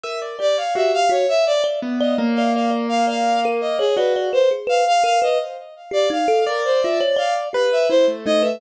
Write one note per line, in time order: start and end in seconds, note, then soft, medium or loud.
0.03 0.36 A#4 medium
0.03 0.19 E5 medium
0.22 0.38 D5 medium
0.39 0.56 G4 medium
0.39 0.55 D5 medium
0.39 0.57 D5 loud
0.57 0.74 C#5 medium
0.57 0.74 F5 medium
0.75 0.91 F#4 medium
0.75 1.08 G4 medium
0.75 0.92 E5 medium
0.94 1.10 F5 loud
1.09 1.25 F#4 medium
1.09 1.27 C#5 medium
1.29 1.45 E5 loud
1.46 1.62 D5 loud
1.64 1.80 D5 loud
1.82 2.14 B3 medium
2.00 2.17 D5 loud
2.00 2.16 D#5 medium
2.18 3.79 A#3 loud
2.18 2.35 D5 medium
2.35 2.54 D5 medium
2.35 2.51 F5 medium
2.54 2.70 D5 medium
2.54 2.70 F5 medium
2.71 2.87 D5 medium
2.89 3.05 F5 medium
3.07 3.39 D5 medium
3.07 3.40 F5 medium
3.45 3.61 A#4 loud
3.61 3.77 D#5 medium
3.79 3.95 G#4 medium
3.79 3.95 C#5 loud
3.96 4.29 F#4 medium
3.96 4.13 B4 medium
3.96 4.14 D5 loud
4.16 4.32 D5 medium
4.33 4.49 B4 medium
4.33 4.49 C5 medium
4.51 4.67 G#4 medium
4.67 4.83 B4 loud
4.67 4.85 F5 medium
4.87 5.03 F5 loud
5.03 5.20 A#4 medium
5.03 5.19 F5 loud
5.22 5.38 B4 loud
5.22 5.38 D#5 medium
5.91 6.07 G4 medium
5.91 6.09 D5 loud
6.10 6.26 D#4 medium
6.10 6.44 F5 medium
6.28 6.44 A4 loud
6.46 6.63 A#4 medium
6.46 7.43 D5 loud
6.64 6.80 C5 medium
6.82 7.00 F4 medium
6.82 6.98 E5 medium
7.00 7.17 C#5 loud
7.16 7.49 D5 loud
7.16 7.33 F5 medium
7.53 7.69 G4 medium
7.53 7.86 B4 loud
7.72 7.88 E5 medium
7.89 8.06 E4 medium
7.89 8.06 C5 loud
8.08 8.24 A3 medium
8.26 8.58 A3 medium
8.26 8.43 D#4 medium
8.26 8.42 D#5 loud
8.42 8.58 B4 medium
8.42 8.59 E5 medium